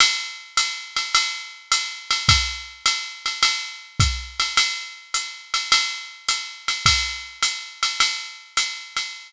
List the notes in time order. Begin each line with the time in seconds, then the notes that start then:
0.00 ride
0.57 hi-hat pedal, ride
0.96 ride
1.15 ride
1.72 hi-hat pedal, ride
2.11 ride
2.29 kick, ride
2.86 hi-hat pedal, ride
3.26 ride
3.43 ride
4.00 kick, hi-hat pedal, ride
4.40 ride
4.57 ride
5.14 hi-hat pedal, ride
5.54 ride
5.72 ride
6.28 hi-hat pedal, ride
6.68 ride
6.86 kick, ride
7.43 hi-hat pedal, ride
7.83 ride
8.00 ride
8.57 hi-hat pedal, ride
8.97 ride